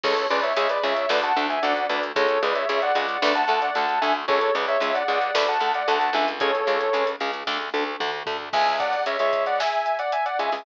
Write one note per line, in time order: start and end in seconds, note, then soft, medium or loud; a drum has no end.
0.03 0.27 C#2 loud
0.03 0.14 C#3 loud
0.03 0.14 G#3 loud
0.03 0.25 A4 medium
0.03 0.25 C#5 medium
0.03 kick medium
0.03 crash medium
0.17 closed hi-hat medium
0.30 0.53 C#2 medium
0.30 0.41 C#3 loud
0.30 0.41 G#3 loud
0.30 0.43 B4 medium
0.30 0.43 D5 medium
0.30 closed hi-hat medium
0.43 0.56 C#5 medium
0.43 0.56 E5 medium
0.43 closed hi-hat medium
0.57 0.79 C#2 medium
0.57 0.67 C#3 loud
0.57 0.67 G#3 loud
0.57 0.69 C#5 medium
0.57 0.69 E5 medium
0.57 closed hi-hat loud
0.69 0.82 B4 medium
0.69 0.82 D5 medium
0.69 closed hi-hat medium
0.83 1.06 C#2 medium
0.83 0.94 C#3 medium
0.83 0.94 G#3 medium
0.83 1.09 C#5 medium
0.83 1.09 E5 medium
0.83 closed hi-hat medium
0.97 closed hi-hat medium
1.09 1.32 D2 medium
1.09 1.20 D3 loud
1.09 1.20 A3 loud
1.09 1.23 B4 medium
1.09 1.23 D5 medium
1.09 snare medium
1.23 1.45 F#5 medium
1.23 1.45 A5 medium
1.23 closed hi-hat medium
1.36 1.59 D2 medium
1.36 1.47 D3 loud
1.36 1.47 A3 medium
1.36 closed hi-hat medium
1.50 1.62 E5 medium
1.50 1.62 G#5 medium
1.50 closed hi-hat medium
1.62 1.87 D2 medium
1.62 1.74 D3 loud
1.62 1.74 A3 medium
1.62 1.85 D5 medium
1.62 1.85 F#5 medium
1.62 closed hi-hat medium
1.76 closed hi-hat medium
1.89 2.12 D2 medium
1.89 2.00 D3 medium
1.89 2.00 A3 medium
1.89 2.02 B4 soft
1.89 2.02 D5 medium
1.89 closed hi-hat medium
2.03 closed hi-hat medium
2.16 2.39 C#2 medium
2.16 2.27 C#3 loud
2.16 2.27 G#3 loud
2.16 2.39 A4 medium
2.16 2.39 C#5 medium
2.16 kick medium
2.16 closed hi-hat loud
2.29 closed hi-hat medium
2.42 2.65 C#2 medium
2.42 2.53 C#3 medium
2.42 2.53 G#3 medium
2.42 2.55 B4 medium
2.42 2.55 D5 medium
2.42 closed hi-hat medium
2.55 2.68 C#5 medium
2.55 2.68 E5 medium
2.55 closed hi-hat medium
2.69 2.92 C#2 medium
2.69 2.80 C#3 medium
2.69 2.80 G#3 medium
2.69 2.81 C#5 medium
2.69 2.81 E5 medium
2.69 closed hi-hat medium
2.82 2.95 D5 medium
2.82 2.95 F#5 medium
2.82 closed hi-hat medium
2.95 3.18 C#2 medium
2.95 3.06 C#3 medium
2.95 3.06 G#3 medium
2.95 3.19 D5 medium
2.95 3.19 F#5 medium
2.95 closed hi-hat medium
3.09 closed hi-hat medium
3.22 3.45 D2 medium
3.22 3.33 D3 loud
3.22 3.33 A3 loud
3.22 3.35 B4 medium
3.22 3.35 D5 medium
3.22 snare medium
3.35 3.60 F#5 medium
3.35 3.60 A5 medium
3.35 closed hi-hat medium
3.48 3.70 D2 medium
3.48 3.59 D3 loud
3.48 3.59 A3 medium
3.48 closed hi-hat medium
3.62 3.75 D5 medium
3.62 3.75 F#5 medium
3.62 closed hi-hat medium
3.75 3.99 D2 medium
3.75 3.86 D3 medium
3.75 3.86 A3 medium
3.75 3.99 F#5 medium
3.75 3.99 A5 medium
3.75 closed hi-hat medium
3.89 closed hi-hat medium
4.01 4.26 D2 medium
4.01 4.12 D3 medium
4.01 4.12 A3 medium
4.01 4.14 E5 medium
4.01 4.14 G#5 medium
4.01 closed hi-hat medium
4.28 4.50 C#2 medium
4.28 4.39 C#3 loud
4.28 4.39 G#3 loud
4.28 4.52 A4 medium
4.28 4.52 C#5 medium
4.28 kick medium
4.41 closed hi-hat medium
4.55 4.77 C#2 medium
4.55 4.66 C#3 loud
4.55 4.66 G#3 medium
4.55 4.67 B4 medium
4.55 4.67 D5 medium
4.55 closed hi-hat medium
4.68 4.81 C#5 medium
4.68 4.81 E5 medium
4.68 closed hi-hat medium
4.80 5.03 C#2 medium
4.80 4.92 C#3 medium
4.80 4.92 G#3 medium
4.80 4.95 C#5 medium
4.80 4.95 E5 medium
4.80 closed hi-hat medium
4.94 5.07 D5 medium
4.94 5.07 F#5 medium
4.94 closed hi-hat medium
5.08 5.31 C#2 medium
5.08 5.19 C#3 medium
5.08 5.19 G#3 loud
5.08 5.33 D5 medium
5.08 5.33 F#5 medium
5.21 closed hi-hat medium
5.34 5.58 D2 medium
5.34 5.45 D3 loud
5.34 5.45 A3 loud
5.34 5.47 B4 medium
5.34 5.47 D5 medium
5.34 snare loud
5.48 5.72 F#5 medium
5.48 5.72 A5 medium
5.48 closed hi-hat medium
5.60 5.83 D2 medium
5.60 5.72 D3 medium
5.60 5.72 A3 medium
5.60 closed hi-hat medium
5.74 5.87 D5 medium
5.74 5.87 F#5 medium
5.74 closed hi-hat medium
5.88 6.10 D2 loud
5.88 5.98 D3 medium
5.88 5.98 A3 loud
5.88 6.13 F#5 medium
5.88 6.13 A5 medium
5.88 closed hi-hat medium
6.01 closed hi-hat medium
6.13 6.62 C#2 loud
6.13 6.25 D3 medium
6.13 6.25 A3 medium
6.13 6.27 E5 medium
6.13 6.27 G#5 medium
6.13 closed hi-hat medium
6.28 closed hi-hat medium
6.40 6.51 C#3 loud
6.40 6.51 G#3 loud
6.40 7.08 A4 medium
6.40 7.08 C#5 medium
6.40 kick medium
6.40 closed hi-hat medium
6.55 closed hi-hat medium
6.67 6.89 C#2 medium
6.67 6.78 C#3 medium
6.67 6.78 G#3 medium
6.67 closed hi-hat medium
6.81 closed hi-hat medium
6.93 7.16 C#2 medium
6.93 7.05 C#3 medium
6.93 7.05 G#3 loud
6.93 closed hi-hat medium
7.07 closed hi-hat medium
7.20 7.43 C#2 medium
7.20 7.31 C#3 medium
7.20 7.31 G#3 loud
7.20 closed hi-hat medium
7.33 closed hi-hat medium
7.47 7.70 D2 medium
7.47 7.58 D3 loud
7.47 7.58 A3 loud
7.47 kick medium
7.47 snare medium
7.74 7.96 D2 medium
7.74 7.84 D3 medium
7.74 7.84 A3 medium
8.00 8.23 D2 medium
8.00 8.11 D3 loud
8.00 8.11 A3 medium
8.00 mid tom medium
8.26 8.49 D2 medium
8.26 8.37 D3 medium
8.26 8.37 A3 medium
8.26 floor tom loud
8.53 8.96 C#2 medium
8.53 8.96 C#3 medium
8.53 8.96 G#3 medium
8.53 8.75 E5 medium
8.53 8.75 G#5 medium
8.53 kick medium
8.53 crash medium
8.67 closed hi-hat medium
8.80 9.02 D5 medium
8.80 9.02 F#5 medium
8.80 kick medium
8.80 closed hi-hat medium
8.93 closed hi-hat medium
9.06 9.17 C#2 medium
9.06 9.17 C#3 medium
9.06 9.17 G#3 medium
9.06 9.19 C#5 medium
9.06 9.19 E5 medium
9.06 closed hi-hat medium
9.19 9.62 C#2 medium
9.19 9.62 C#3 medium
9.19 9.62 G#3 medium
9.19 9.43 C#5 medium
9.19 9.43 E5 medium
9.19 closed hi-hat medium
9.33 kick medium
9.33 closed hi-hat medium
9.46 9.59 D5 medium
9.46 9.59 F#5 medium
9.46 closed hi-hat medium
9.60 9.97 E5 medium
9.60 9.97 G#5 medium
9.60 snare medium
9.73 closed hi-hat medium
9.86 closed hi-hat medium
9.99 10.12 D5 medium
9.99 10.12 F#5 medium
9.99 closed hi-hat medium
10.12 10.25 E5 medium
10.12 10.25 G#5 medium
10.12 closed hi-hat medium
10.26 10.38 D5 medium
10.26 10.38 F#5 medium
10.26 closed hi-hat medium
10.39 10.50 C#2 medium
10.39 10.50 C#3 medium
10.39 10.50 G#3 medium
10.39 10.65 E5 medium
10.39 10.65 G#5 medium
10.39 closed hi-hat medium
10.52 10.63 C#2 medium
10.52 10.63 C#3 medium
10.52 10.63 G#3 medium
10.52 open hi-hat medium